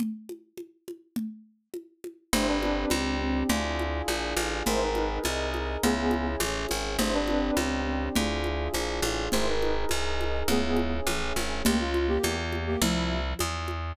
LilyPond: <<
  \new Staff \with { instrumentName = "Brass Section" } { \time 2/2 \key b \phrygian \tempo 2 = 103 r1 | r1 | <e' c''>8 <d' b'>4. r2 | r1 |
<e' c''>8 <dis' b'>4. r2 | <b gis'>4. r2 r8 | <e' c''>8 <d' b'>4. r2 | r1 |
<e' c''>8 <dis' b'>4. r2 | <b gis'>4. r2 r8 | \key c \phrygian r1 | r1 | }
  \new Staff \with { instrumentName = "Flute" } { \time 2/2 \key b \phrygian r1 | r1 | d'4 c'2 c'4 | e'1 |
ais'4. r8 dis''2 | e'2 e8 r4. | d'4 c'2 c'4 | e'1 |
ais'4. r8 dis''2 | e'2 e8 r4. | \key c \phrygian <bes g'>8 f'4 <bes g'>4 r4 <bes g'>8 | <f e'>4. r2 r8 | }
  \new Staff \with { instrumentName = "Electric Piano 2" } { \time 2/2 \key b \phrygian r1 | r1 | <c' d' g'>1 | <d' f' aes'>1 |
<dis' gis' ais'>1 | <cis' e' gis'>1 | <c' d' g'>1 | <d' f' aes'>1 |
<dis' gis' ais'>1 | <cis' e' gis'>1 | \key c \phrygian r1 | r1 | }
  \new Staff \with { instrumentName = "Electric Bass (finger)" } { \clef bass \time 2/2 \key b \phrygian r1 | r1 | g,,2 cis,2 | d,2 ais,,4 a,,4 |
gis,,2 c,2 | cis,2 a,,4 gis,,4 | g,,2 cis,2 | d,2 ais,,4 a,,4 |
gis,,2 c,2 | cis,2 a,,4 gis,,4 | \key c \phrygian des,2 fes,2 | c,2 e,2 | }
  \new DrumStaff \with { instrumentName = "Drums" } \drummode { \time 2/2 cgl4 cgho4 cgho4 cgho4 | cgl2 cgho4 cgho4 | cgl4 cgho4 cgho2 | cgl4 cgho4 cgho4 cgho4 |
cgl4 cgho4 cgho4 cgho4 | cgl4 cgho4 cgho4 cgho4 | cgl4 cgho4 cgho2 | cgl4 cgho4 cgho4 cgho4 |
cgl4 cgho4 cgho4 cgho4 | cgl4 cgho4 cgho4 cgho4 | cgl4 cgho4 cgho4 cgho4 | cgl2 cgho4 cgho4 | }
>>